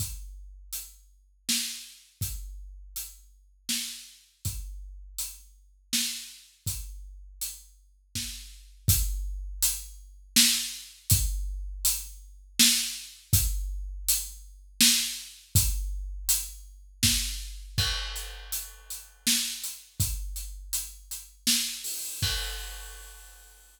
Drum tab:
CC |------|------|------|------|
HH |x-x---|x-x---|x-x---|x-x---|
SD |----o-|----o-|----o-|----o-|
BD |o-----|o-----|o-----|o---o-|

CC |------|------|------|------|
HH |x-x---|x-x---|x-x---|x-x---|
SD |----o-|----o-|----o-|----o-|
BD |o-----|o-----|o-----|o---o-|

CC |x-----|------|x-----|
HH |-xxx-x|xxxx-o|------|
SD |----o-|----o-|------|
BD |o-----|o-----|o-----|